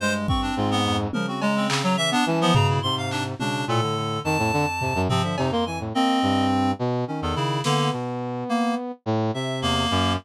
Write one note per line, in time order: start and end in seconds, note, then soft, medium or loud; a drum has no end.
0.00 0.51 G2 medium
0.00 0.27 G#3 medium
0.00 0.13 C5 loud
0.28 0.80 C4 medium
0.28 0.41 C#6 medium
0.28 kick medium
0.42 0.55 D4 medium
0.57 1.08 G#2 loud
0.57 0.69 F4 medium
0.71 0.96 B3 loud
0.85 1.11 F2 medium
1.13 2.15 C#3 medium
1.13 1.27 F3 medium
1.13 1.26 A#4 medium
1.13 high tom medium
1.28 1.41 C4 soft
1.28 1.40 F#4 medium
1.42 1.67 G#3 loud
1.42 1.55 A#5 medium
1.42 cowbell loud
1.56 1.82 C4 medium
1.69 1.82 C#3 medium
1.69 clap loud
1.83 1.96 F#3 loud
1.83 1.97 A#5 medium
1.97 2.11 E3 medium
1.97 2.10 E5 loud
2.11 2.24 B3 loud
2.11 2.25 D4 loud
2.26 2.52 E3 loud
2.26 2.40 C#4 soft
2.26 2.39 A5 medium
2.26 high tom medium
2.41 2.54 F3 loud
2.41 2.54 B3 loud
2.54 2.80 B2 medium
2.54 2.80 C#3 loud
2.54 2.67 A#5 medium
2.54 floor tom loud
2.69 2.82 E4 medium
2.82 3.35 G#2 medium
2.82 3.34 C3 medium
2.82 2.95 C6 loud
2.97 3.10 F5 medium
3.11 3.23 D4 medium
3.11 clap medium
3.39 3.65 B2 medium
3.39 3.65 C#3 medium
3.39 3.65 D4 medium
3.39 high tom medium
3.68 4.19 A2 medium
3.68 3.80 A#2 loud
3.68 4.20 A4 medium
3.82 3.95 D3 medium
3.96 4.22 D3 medium
4.24 5.00 F2 medium
4.24 4.37 D#3 loud
4.24 5.01 A5 loud
4.38 4.51 A2 loud
4.53 4.66 D3 loud
4.81 4.94 C3 medium
4.81 floor tom medium
4.95 5.08 F#2 loud
5.09 5.22 C3 loud
5.09 5.35 F3 medium
5.09 5.22 C4 medium
5.09 floor tom medium
5.23 5.36 D3 medium
5.23 5.36 E5 medium
5.38 5.89 F2 medium
5.38 5.50 C3 loud
5.38 5.51 D#4 medium
5.38 cowbell loud
5.52 5.65 A#3 loud
5.52 5.65 C6 medium
5.66 5.79 E3 medium
5.66 5.79 G#5 medium
5.80 5.93 A2 medium
5.94 6.20 A#3 medium
5.94 6.71 C4 loud
5.94 6.45 D#5 medium
6.22 6.73 G2 medium
6.79 7.05 B2 loud
7.08 7.59 D#3 medium
7.08 7.21 C#4 medium
7.22 7.35 E2 loud
7.22 7.35 A4 medium
7.35 7.62 C#3 loud
7.35 7.61 E4 medium
7.64 7.90 D3 loud
7.64 7.89 A#3 medium
7.64 8.92 B3 medium
7.64 snare medium
7.93 8.44 B2 medium
8.49 8.75 A#3 loud
9.06 9.31 A2 loud
9.34 9.85 C3 medium
9.34 9.60 E5 medium
9.62 9.88 E2 medium
9.62 10.13 A#3 loud
9.91 10.17 F#2 loud
9.91 10.16 F#3 medium